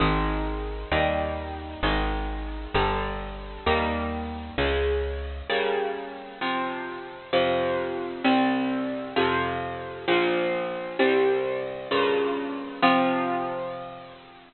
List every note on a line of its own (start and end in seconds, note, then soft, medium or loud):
0.00 0.85 G#1 medium
0.00 0.90 D#3 medium
0.00 0.90 G#3 medium
0.92 1.76 D#2 medium
0.92 1.81 D#3 medium
0.92 1.81 G3 medium
0.92 1.81 A#3 medium
1.83 2.67 G#1 medium
1.83 2.73 D#3 medium
1.83 2.73 G#3 medium
2.74 3.59 G1 medium
2.74 3.64 D3 medium
2.74 3.64 G3 medium
3.66 4.51 D#2 medium
3.66 4.56 D#3 medium
3.66 4.56 G3 medium
3.66 4.56 A#3 medium
4.58 5.42 C#2 medium
4.58 5.48 C#3 medium
4.58 5.48 G#3 medium
5.50 6.39 C#3 medium
5.50 6.39 G3 medium
5.50 6.39 A#3 medium
6.41 7.31 C3 medium
6.41 7.31 F3 medium
7.33 8.23 F2 medium
7.33 8.23 C3 medium
7.33 8.23 F3 medium
8.24 9.14 C2 medium
8.24 9.14 C3 medium
8.24 9.14 G3 medium
9.16 10.06 F2 medium
9.16 10.06 C3 medium
9.16 10.06 F3 medium
10.08 10.98 A#1 medium
10.08 10.98 A#2 medium
10.08 10.98 F3 medium
10.99 11.89 C2 medium
10.99 11.89 C3 medium
10.99 11.89 G3 medium
11.91 12.81 G2 medium
11.91 12.81 A#2 medium
11.91 12.81 C#3 medium
12.82 14.53 C3 loud
12.82 14.53 F3 loud